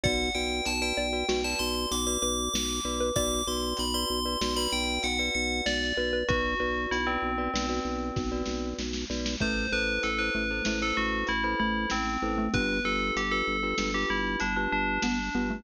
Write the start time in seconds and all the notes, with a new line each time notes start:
0.03 B1 F#4 B4 D5 F#5, kick, closed hi-hat
0.35 B1 F#4 B4 D5 G5
0.65 B1 A5, closed hi-hat
0.82 F#4 B4 D5 G5
0.97 B1 D5
1.13 F#4 B4 D5
1.29 B1 F#4 B4 D5, snare
1.44 F#4 B4 D5 A5
1.59 B1 C6
1.91 B1 D6, closed hi-hat
2.07 F#4 B4 D5 D6
2.22 B1 B4 D6
2.53 B1 D6, snare
2.85 B1 F#4 B4 D5
3.00 B4
3.16 B1 F#4 B4 D5 D6, kick, closed hi-hat
3.47 B1 F#4 B4 D5 C6
3.77 B1 B5, closed hi-hat
3.94 F#4 B4 D5 C6
4.10 B1
4.25 F#4 B4 D5
4.41 B1 F#4 B4 D5, snare
4.56 F#4 B4 D5 B5
4.72 B1 G5
5.03 B1 F#5, closed hi-hat
5.19 F#4 B4 D5 F#5
5.35 B1 F#5
5.66 B1 D5, snare
5.97 B1 F#4 B4 D5
6.13 B4
6.28 B1 F#4 B4 D5, kick, closed hi-hat
6.60 B1 F#4 B4 D5
6.91 B1 E4, closed hi-hat
7.07 C4 F#4 B4 D5
7.22 B1
7.38 F#4 B4 D5
7.54 B1 F#4 B4 D5, snare
7.69 F#4 B4 D5
7.85 B1
8.16 B1, kick, snare
8.32 F#4 B4 D5
8.45 B1, snare
8.79 B1, snare
8.93 snare
9.10 B1 F#4 B4 D5, snare
9.26 snare
9.40 A1 A3 E4 A4 B4 C5, kick, closed hi-hat
9.72 A1 E4 A4 B4 C5
10.03 A1 A4, closed hi-hat
10.18 E4 A4 B4 C5
10.35 A1 A3
10.50 E4 A4 B4 C5
10.65 A1 A3 E4 A4 B4 C5, snare
10.82 E4 A4 B4 C5
10.97 A1 F#4
11.27 A1 E4, closed hi-hat
11.44 E4 A4 B4 C5
11.60 A1 A3 E4
11.90 A1 C4, snare
12.22 A1 E4 A4 B4 C5
12.38 A3
12.54 G1 B3 D4 F4 G4 B4, kick, closed hi-hat
12.85 G1 D4 F4 G4 A4 B4
13.16 G1 G4, closed hi-hat
13.31 D4 F4 G4 A4 B4
13.47 G1
13.63 D4 F4 G4 B4
13.78 G1 D4 F4 G4 B4, snare
13.94 D4 F4 G4 B4
14.10 G1 E4
14.40 G1 D4, closed hi-hat
14.56 D4 F4 G4 B4
14.72 G1 D4
15.02 G1 B3 D4, snare
15.35 G1 B3 D4 F4 G4 B4
15.50 A3